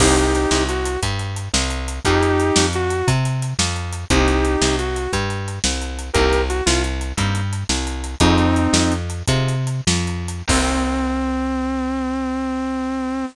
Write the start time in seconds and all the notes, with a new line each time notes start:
0.00 C2 A#3 C4 D#4 G4, kick, crash
0.17 closed hi-hat
0.35 closed hi-hat
0.51 C2, snare
0.69 F#4, closed hi-hat
0.85 closed hi-hat
1.02 G2, kick, closed hi-hat
1.19 closed hi-hat
1.36 closed hi-hat
1.54 C2, snare
1.70 closed hi-hat
1.88 closed hi-hat
2.05 F2 C4 D#4 F4 G4 G#4, kick, closed hi-hat
2.23 closed hi-hat
2.40 closed hi-hat
2.56 F2, snare
2.73 F#4, closed hi-hat
2.90 closed hi-hat
3.08 C3, kick, closed hi-hat
3.25 closed hi-hat
3.42 closed hi-hat
3.59 F2, snare
3.76 closed hi-hat
3.93 closed hi-hat
4.10 C2 A#3 C4 D#4 G4, kick, closed hi-hat
4.28 closed hi-hat
4.45 closed hi-hat
4.61 C2, snare
4.79 F#4, closed hi-hat
4.96 closed hi-hat
5.13 G2, kick, closed hi-hat
5.30 closed hi-hat
5.48 closed hi-hat
5.64 C2, snare
5.82 closed hi-hat
5.99 closed hi-hat
6.13 C2 A#3 C4 D#4 G4 A#4, kick, closed hi-hat
6.33 closed hi-hat
6.49 F#4, closed hi-hat
6.66 C2 F4, snare
6.84 closed hi-hat
7.01 closed hi-hat
7.17 G2 A#3 C4 D#4 G4, kick, closed hi-hat
7.35 closed hi-hat
7.53 closed hi-hat
7.69 C2, snare
7.87 closed hi-hat
8.04 closed hi-hat
8.20 F2 C4 D#4 F4 G#4, kick, closed hi-hat
8.38 closed hi-hat
8.56 closed hi-hat
8.73 F2, snare
8.92 closed hi-hat
9.10 closed hi-hat
9.28 C3 C4 D#4 F4 G#4, kick, closed hi-hat
9.48 closed hi-hat
9.67 closed hi-hat
9.87 F2, snare
10.07 closed hi-hat
10.28 closed hi-hat
10.48 C2 A#3 C4 D#4 G4, kick, crash